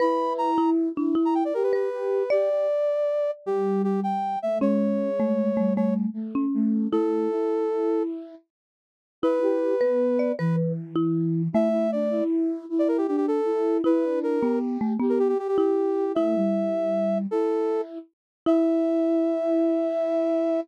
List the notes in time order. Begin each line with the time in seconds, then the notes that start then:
0.00 E4 B4 B5
0.38 A#5
0.58 E4
0.95 D4 E4
1.15 E4
1.25 A#5
1.35 G5
1.45 D5
1.54 G4 A#4
1.63 B4
1.73 B4
1.92 G4
2.30 G4 D5
2.50 G4
3.46 G3 G4
3.84 G4
4.03 G5
4.42 A3 E5
4.60 G#3 C#4 C#5
5.20 A3
5.57 G3 A3
5.76 A3 C#5
6.13 A3
6.35 C#4
6.54 A3
6.91 A3 E4 A4
7.30 E4
9.22 E4 B4
9.42 G4
9.81 B3 B4
10.19 D5
10.38 E3 B4
10.96 E4
11.53 A3 E4 E5
11.71 E4
11.92 D4 D5
12.10 E4
12.69 E4
12.79 D5
12.88 A#4
12.98 G4
13.08 D4 G4
13.17 G4
13.28 A4
13.45 E4
13.84 E4 B4
14.04 D4
14.23 A#4
14.40 B3 G4
14.81 A3
15.00 B3 G4
15.09 A#4
15.19 G4
15.29 G4
15.39 G4
15.48 G4
15.58 E4 G4
16.15 A3 E4 E5
16.36 G3
17.31 E4 A4
18.46 E4 E5